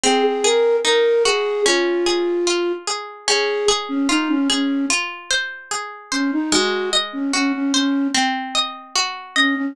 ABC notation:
X:1
M:4/4
L:1/16
Q:1/4=74
K:Db
V:1 name="Flute"
A A B2 B2 A2 F6 z2 | A2 z D E D D2 z6 D E | G2 z D D D D2 z6 D D |]
V:2 name="Orchestral Harp"
C2 A2 E2 G2 D2 A2 F2 A2 | D2 A2 F2 A2 F2 c2 A2 c2 | A,2 e2 G2 c2 C2 e2 G2 e2 |]